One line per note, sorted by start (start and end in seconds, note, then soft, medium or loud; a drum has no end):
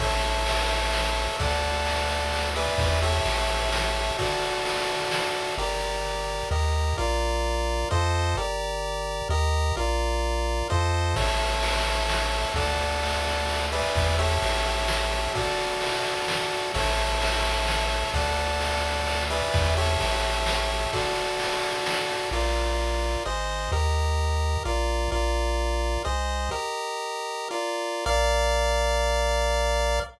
0.00 1.28 A1 medium
0.00 1.37 A4 medium
0.00 1.37 C#5 medium
0.00 1.37 E5 medium
0.00 kick loud
0.00 crash loud
0.23 ride medium
0.46 ride loud
0.69 ride medium
0.93 snare loud
1.16 ride medium
1.39 2.69 D2 medium
1.39 2.50 A4 medium
1.39 2.50 D5 medium
1.39 2.50 F#5 medium
1.39 kick loud
1.39 ride medium
1.63 ride medium
1.86 ride loud
2.09 ride medium
2.33 ride loud
2.55 3.00 G#4 medium
2.55 3.00 B4 medium
2.55 3.00 D5 medium
2.55 3.00 E5 medium
2.55 ride medium
2.78 3.21 E2 medium
2.78 kick loud
2.78 ride loud
3.02 4.17 G4 medium
3.02 4.17 A4 medium
3.02 4.17 C#5 medium
3.02 4.17 E5 medium
3.02 ride medium
3.25 4.11 A1 medium
3.25 ride loud
3.49 ride medium
3.72 snare loud
3.95 ride medium
4.19 5.55 F#4 medium
4.19 5.55 A4 medium
4.19 5.55 D5 medium
4.19 kick loud
4.19 ride loud
4.42 ride medium
4.65 ride loud
4.89 ride medium
5.11 snare loud
5.35 ride medium
5.58 6.43 G1 medium
5.58 6.49 G4 medium
5.58 6.49 A#4 medium
5.58 6.49 D5 medium
6.51 6.94 D#2 loud
6.51 6.97 G4 medium
6.51 6.97 A#4 medium
6.51 6.97 D#5 medium
6.98 7.85 A#1 medium
6.98 7.89 F4 medium
6.98 7.89 A#4 medium
6.98 7.89 D5 medium
7.91 8.35 F2 medium
7.91 8.36 F4 medium
7.91 8.36 A4 medium
7.91 8.36 C5 medium
7.91 8.36 D#5 medium
8.36 9.22 G1 medium
8.36 9.28 G4 medium
8.36 9.28 A#4 medium
8.36 9.28 D5 medium
9.29 9.72 D#2 loud
9.29 9.76 G4 medium
9.29 9.76 A#4 medium
9.29 9.76 D#5 medium
9.77 10.63 A#1 medium
9.77 10.68 F4 medium
9.77 10.68 A#4 medium
9.77 10.68 D5 medium
10.70 11.15 F2 medium
10.70 11.15 F4 medium
10.70 11.15 A4 medium
10.70 11.15 C5 medium
10.70 11.15 D#5 medium
11.16 12.45 A1 medium
11.16 12.53 A4 medium
11.16 12.53 C#5 medium
11.16 12.53 E5 medium
11.16 kick loud
11.16 crash loud
11.40 ride medium
11.63 ride loud
11.86 ride medium
12.09 snare loud
12.33 ride medium
12.54 13.83 D2 medium
12.54 13.66 A4 medium
12.54 13.66 D5 medium
12.54 13.66 F#5 medium
12.54 kick loud
12.54 ride medium
12.79 ride medium
13.03 ride loud
13.26 ride medium
13.49 ride loud
13.72 14.16 G#4 medium
13.72 14.16 B4 medium
13.72 14.16 D5 medium
13.72 14.16 E5 medium
13.72 ride medium
13.95 14.38 E2 medium
13.95 kick loud
13.95 ride loud
14.19 15.33 G4 medium
14.19 15.33 A4 medium
14.19 15.33 C#5 medium
14.19 15.33 E5 medium
14.19 ride medium
14.42 15.28 A1 medium
14.42 ride loud
14.66 ride medium
14.88 snare loud
15.11 ride medium
15.35 16.72 F#4 medium
15.35 16.72 A4 medium
15.35 16.72 D5 medium
15.35 kick loud
15.35 ride loud
15.58 ride medium
15.81 ride loud
16.04 ride medium
16.28 snare loud
16.51 ride medium
16.74 18.04 A1 medium
16.74 18.11 A4 medium
16.74 18.11 C#5 medium
16.74 18.11 E5 medium
16.74 kick loud
16.74 crash loud
16.98 ride medium
17.21 ride loud
17.44 ride medium
17.67 snare loud
17.91 ride medium
18.14 19.42 D2 medium
18.14 19.24 A4 medium
18.14 19.24 D5 medium
18.14 19.24 F#5 medium
18.14 kick loud
18.14 ride medium
18.37 ride medium
18.61 ride loud
18.84 ride medium
19.06 ride loud
19.30 19.74 G#4 medium
19.30 19.74 B4 medium
19.30 19.74 D5 medium
19.30 19.74 E5 medium
19.30 ride medium
19.54 19.97 E2 medium
19.54 kick loud
19.54 ride loud
19.77 20.91 G4 medium
19.77 20.91 A4 medium
19.77 20.91 C#5 medium
19.77 20.91 E5 medium
19.77 ride medium
20.00 20.87 A1 medium
20.00 ride loud
20.23 ride medium
20.46 snare loud
20.70 ride medium
20.93 22.30 F#4 medium
20.93 22.30 A4 medium
20.93 22.30 D5 medium
20.93 kick loud
20.93 ride loud
21.16 ride medium
21.39 ride loud
21.63 ride medium
21.86 snare loud
22.10 ride medium
22.31 23.17 A#1 medium
22.31 23.24 F4 medium
22.31 23.24 A#4 medium
22.31 23.24 D5 medium
23.26 23.69 G#1 medium
23.26 23.71 G#4 medium
23.26 23.71 C5 medium
23.26 23.71 D#5 medium
23.72 24.57 D#2 loud
23.72 24.63 G4 medium
23.72 24.63 A#4 medium
23.72 24.63 D#5 medium
24.65 25.08 A#1 medium
24.65 25.11 F4 medium
24.65 25.11 A#4 medium
24.65 25.11 D5 medium
25.12 25.98 A#1 loud
25.12 26.03 F4 medium
25.12 26.03 A#4 medium
25.12 26.03 D5 medium
26.05 26.49 C2 medium
26.05 26.50 G#4 medium
26.05 26.50 C5 medium
26.05 26.50 D#5 medium
26.51 27.49 G4 medium
26.51 27.49 A#4 medium
26.51 27.49 D#5 medium
27.51 28.05 F4 medium
27.51 28.05 A#4 medium
27.51 28.05 D5 medium
28.06 30.00 A#1 medium
28.06 30.00 A#4 medium
28.06 30.00 D5 loud
28.06 30.00 F5 medium